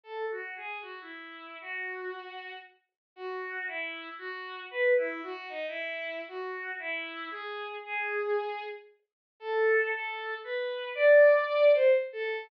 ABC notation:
X:1
M:2/2
L:1/8
Q:1/2=77
K:F#dor
V:1 name="Violin"
(3A2 F2 G2 F E3 | F5 z3 | [K:Bdor] (3F4 E4 F4 | (3B2 E2 F2 ^D E3 |
(3F4 E4 G4 | G5 z3 | [K:F#dor] (3A4 A4 B4 | =d4 =c z A2 |]